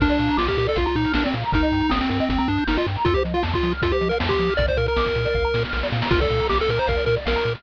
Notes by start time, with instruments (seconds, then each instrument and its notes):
0.00 synth bass 1 A#1, lead 1 (square) D4 A#4, kick, crash
0.09 lead 1 (square) D5, closed hi-hat
0.19 synth bass 1 A#2, lead 1 (square) F5, closed hi-hat
0.28 lead 1 (square) A#5, closed hi-hat
0.37 synth bass 1 A#1, lead 1 (square) F4 D6, snare
0.47 lead 1 (square) G4 F6, kick, closed hi-hat
0.57 synth bass 1 A#2, lead 1 (square) G4 A#4, closed hi-hat
0.67 lead 1 (square) A4 D5, closed hi-hat
0.76 synth bass 1 A#1, lead 1 (square) F4 F5, kick, closed hi-hat
0.86 lead 1 (square) F4 A#5, closed hi-hat
0.96 synth bass 1 A#2, lead 1 (square) D#4 D6, closed hi-hat
1.05 lead 1 (square) F6, closed hi-hat
1.14 synth bass 1 A#1, lead 1 (square) D4 A#4, snare
1.24 lead 1 (square) C4 D5, closed hi-hat
1.34 synth bass 1 A#2, lead 1 (square) F5, closed hi-hat
1.43 lead 1 (square) A#5, closed hi-hat
1.52 synth bass 1 G1, lead 1 (square) D#4 A#4, kick, closed hi-hat
1.63 lead 1 (square) D#5, closed hi-hat
1.72 synth bass 1 G2, lead 1 (square) G5, closed hi-hat
1.81 lead 1 (square) A#5, closed hi-hat
1.89 synth bass 1 G1, lead 1 (square) C4 D#6, snare
2.01 lead 1 (square) C4 G6, closed hi-hat
2.09 synth bass 1 G2, lead 1 (square) C4 A#4, closed hi-hat
2.20 lead 1 (square) C4 D#5, closed hi-hat
2.29 synth bass 1 G1, lead 1 (square) C4 G5, kick, closed hi-hat
2.38 lead 1 (square) C4 A#5, closed hi-hat
2.48 synth bass 1 G2, lead 1 (square) D4 D#6, closed hi-hat
2.57 lead 1 (square) G6, closed hi-hat
2.67 synth bass 1 G1, lead 1 (square) D#4 A#4, snare
2.76 lead 1 (square) F4 D#5, closed hi-hat
2.87 synth bass 1 G2, lead 1 (square) G5, closed hi-hat
2.95 lead 1 (square) A#5, closed hi-hat
3.05 synth bass 1 F2, lead 1 (square) F4 A4, kick, closed hi-hat
3.14 lead 1 (square) G4 C5, closed hi-hat
3.24 synth bass 1 F3, lead 1 (square) D#5, closed hi-hat
3.34 lead 1 (square) F4 F5, closed hi-hat
3.43 synth bass 1 F2, lead 1 (square) A5, snare
3.54 lead 1 (square) F4 C6, kick, closed hi-hat
3.63 synth bass 1 F3, lead 1 (square) D#6, closed hi-hat
3.72 lead 1 (square) F6, closed hi-hat
3.82 synth bass 1 F2, lead 1 (square) F4 A4, kick, closed hi-hat
3.91 lead 1 (square) G4 C5, closed hi-hat
4.01 synth bass 1 F3, lead 1 (square) D#5, closed hi-hat
4.09 lead 1 (square) A#4 F5, closed hi-hat
4.20 synth bass 1 F2, lead 1 (square) A5, snare, closed hi-hat
4.29 lead 1 (square) G4 C6, kick, closed hi-hat
4.39 synth bass 1 F3, lead 1 (square) D#6, closed hi-hat
4.48 lead 1 (square) F6, closed hi-hat
4.57 synth bass 1 A#1, lead 1 (square) A#4 D5, kick, closed hi-hat
4.68 lead 1 (square) C5 D5, kick, closed hi-hat
4.77 synth bass 1 A#2, lead 1 (square) A#4 F5, closed hi-hat
4.86 lead 1 (square) A#4 A#5, closed hi-hat
4.96 synth bass 1 A#1, lead 1 (square) D6, snare
5.06 lead 1 (square) F6, kick, closed hi-hat
5.15 synth bass 1 A#2, lead 1 (square) A#4, closed hi-hat
5.25 lead 1 (square) D5, closed hi-hat
5.34 synth bass 1 A#1, lead 1 (square) F5, kick
5.45 lead 1 (square) A#5
5.54 synth bass 1 A#2, lead 1 (square) D6, snare
5.64 lead 1 (square) F6, snare
5.73 synth bass 1 A#1, lead 1 (square) A#4, snare
5.83 lead 1 (square) D5, snare
5.92 synth bass 1 A#2, lead 1 (square) F5, snare
6.02 lead 1 (square) A#5, snare
6.11 synth bass 1 A#1, lead 1 (square) F4 A#4, kick, crash
6.20 lead 1 (square) A4 D5, kick, closed hi-hat
6.30 synth bass 1 A#2, lead 1 (square) F5, closed hi-hat
6.40 lead 1 (square) A#5, closed hi-hat
6.49 synth bass 1 A#1, lead 1 (square) G4 D6, snare
6.59 lead 1 (square) A4 F6, closed hi-hat
6.69 synth bass 1 A#2, lead 1 (square) A#4 D6, closed hi-hat
6.78 lead 1 (square) C5 A#5, closed hi-hat
6.87 synth bass 1 A#1, lead 1 (square) A#4 F5, kick, closed hi-hat
6.96 lead 1 (square) D5, closed hi-hat
7.06 synth bass 1 A#2, lead 1 (square) A#4, closed hi-hat
7.16 lead 1 (square) D5, closed hi-hat
7.25 synth bass 1 A#1, lead 1 (square) A#4 F5, snare
7.36 lead 1 (square) A#5, closed hi-hat
7.44 synth bass 1 A#2, lead 1 (square) D6, closed hi-hat
7.55 lead 1 (square) F6, closed hi-hat